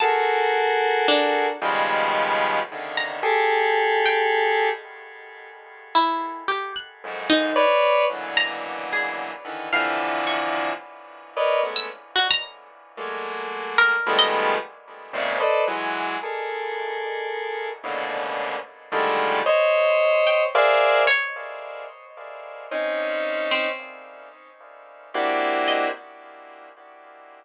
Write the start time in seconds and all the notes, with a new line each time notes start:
0.00 F#4 G#4 A4 A#4 A5
1.08 D4
1.61 B2 C#3 D#3 F3 G3 G#3
2.72 C3 C#3 D3 D#3
2.97 A#5
3.23 G4 G#4 A4
4.06 G5
5.95 E4
6.48 G4
6.76 F#6
7.03 F2 F#2 G#2
7.30 D#4
7.56 B4 C#5 D5
8.10 A#2 B2 C#3 D3 E3 F#3
8.37 A#5
8.93 G#4
9.44 D3 D#3 E3
9.73 C3 D3 E3 F3 F5
10.27 C#6
11.36 A#4 B4 C#5 D5 D#5
11.63 G#3 A3 B3 C#4
11.76 E6
12.16 F#4
12.31 A#5
12.97 F#3 G#3 A3 A#3
13.78 A#4
14.06 D#3 F3 G3 G#3 A3 B3
14.19 D#5
15.13 G#2 A#2 C3 C#3
15.40 A4 B4 C5 D5 D#5
15.67 E3 F#3 G#3
16.23 G#4 A4 A#4
17.83 G#2 A2 A#2 B2 C#3 D3
18.92 D3 D#3 F3 G3 G#3 A3
19.46 C5 C#5 D#5
20.27 G5
20.55 G#4 A#4 C5 D5 E5 F5
21.07 C#5
22.71 C4 C#4 D#4
23.51 C4
25.14 A#3 C4 D4 E4 F#4 G4
25.68 D#5